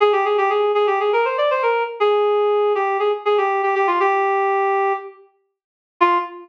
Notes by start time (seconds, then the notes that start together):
0.00 G#4
0.12 G4
0.25 G#4
0.38 G4
0.50 G#4
0.75 G#4
0.87 G4
1.00 G#4
1.13 A#4
1.25 C5
1.38 D5
1.51 C5
1.63 A#4
2.00 G#4
2.75 G4
2.99 G#4
3.25 G#4
3.38 G4
3.63 G4
3.75 G4
3.87 F4
4.00 G4
6.01 F4